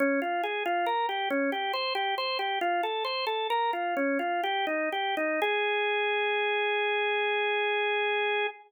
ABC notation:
X:1
M:3/4
L:1/16
Q:1/4=69
K:Ab
V:1 name="Drawbar Organ"
D F A F B G D G c G c G | "^rit." F =A c A B F D F G E G E | A12 |]